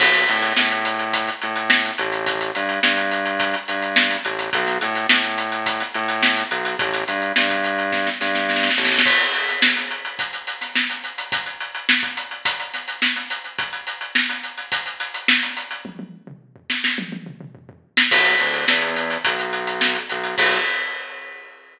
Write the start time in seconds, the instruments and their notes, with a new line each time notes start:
0.00 synth bass 1 B1, kick, crash
0.14 snare, closed hi-hat
0.28 synth bass 1 A2, closed hi-hat
0.42 snare, closed hi-hat
0.57 synth bass 1 A2, snare
0.71 closed hi-hat
0.85 closed hi-hat
0.99 closed hi-hat
1.13 kick, closed hi-hat
1.27 closed hi-hat
1.42 synth bass 1 A2, closed hi-hat
1.56 closed hi-hat
1.70 snare
1.84 closed hi-hat
1.98 synth bass 1 A1, closed hi-hat
2.12 closed hi-hat
2.26 kick, closed hi-hat
2.41 closed hi-hat
2.55 synth bass 1 G2, closed hi-hat
2.69 closed hi-hat
2.83 synth bass 1 G2, snare
2.97 closed hi-hat
3.11 closed hi-hat
3.25 closed hi-hat
3.40 kick, closed hi-hat
3.54 closed hi-hat
3.68 synth bass 1 G2, closed hi-hat
3.82 closed hi-hat
3.96 snare
4.10 snare, closed hi-hat
4.25 synth bass 1 A1, closed hi-hat
4.39 snare, closed hi-hat
4.53 synth bass 1 B1, kick, closed hi-hat
4.67 snare, closed hi-hat
4.81 synth bass 1 A2, closed hi-hat
4.95 closed hi-hat
5.09 synth bass 1 A2, snare
5.24 closed hi-hat
5.38 closed hi-hat
5.52 closed hi-hat
5.66 kick, closed hi-hat
5.80 snare, closed hi-hat
5.94 synth bass 1 A2, closed hi-hat
6.08 closed hi-hat
6.23 snare
6.37 closed hi-hat
6.51 synth bass 1 B1, closed hi-hat
6.65 closed hi-hat
6.79 synth bass 1 A1, kick, closed hi-hat
6.93 snare, closed hi-hat
7.08 synth bass 1 G2, closed hi-hat
7.22 closed hi-hat
7.36 synth bass 1 G2, snare
7.50 kick, closed hi-hat
7.64 closed hi-hat
7.78 closed hi-hat
7.92 kick, snare
8.07 snare
8.21 synth bass 1 G2, snare
8.35 snare
8.49 snare
8.56 snare
8.63 snare
8.70 snare
8.77 synth bass 1 A1, snare
8.85 snare
8.92 snare
8.98 snare
9.06 kick, crash
9.20 closed hi-hat
9.34 closed hi-hat
9.48 snare, closed hi-hat
9.62 snare
9.76 snare, closed hi-hat
9.91 closed hi-hat
10.05 closed hi-hat
10.19 kick, closed hi-hat
10.33 closed hi-hat
10.47 closed hi-hat
10.61 snare, closed hi-hat
10.75 snare
10.90 closed hi-hat
11.04 closed hi-hat
11.18 closed hi-hat
11.32 kick, closed hi-hat
11.46 closed hi-hat
11.60 closed hi-hat
11.75 closed hi-hat
11.89 snare
12.03 kick, closed hi-hat
12.17 closed hi-hat
12.31 closed hi-hat
12.45 kick, closed hi-hat
12.59 closed hi-hat
12.74 snare, closed hi-hat
12.88 closed hi-hat
13.02 snare
13.16 snare, closed hi-hat
13.30 closed hi-hat
13.44 closed hi-hat
13.58 kick, closed hi-hat
13.73 closed hi-hat
13.87 closed hi-hat
14.01 closed hi-hat
14.15 snare
14.29 snare, closed hi-hat
14.43 closed hi-hat
14.58 closed hi-hat
14.72 kick, closed hi-hat
14.86 closed hi-hat
15.00 closed hi-hat
15.14 closed hi-hat
15.28 snare
15.42 closed hi-hat
15.56 closed hi-hat
15.71 closed hi-hat
15.85 kick, high tom
15.99 high tom
16.27 mid tom
16.56 floor tom
16.70 snare
16.84 snare
16.98 high tom
17.12 high tom
17.26 mid tom
17.41 mid tom
17.55 floor tom
17.69 floor tom
17.97 snare
18.11 synth bass 1 B1, kick, crash
18.25 closed hi-hat
18.40 synth bass 1 D2, closed hi-hat
18.54 closed hi-hat
18.68 synth bass 1 E2, snare
18.82 snare, closed hi-hat
18.96 snare, closed hi-hat
19.10 snare, closed hi-hat
19.25 synth bass 1 B1, kick, closed hi-hat
19.39 closed hi-hat
19.53 closed hi-hat
19.67 closed hi-hat
19.81 snare
19.95 closed hi-hat
20.09 synth bass 1 B1, closed hi-hat
20.24 closed hi-hat
20.38 synth bass 1 B1, kick, crash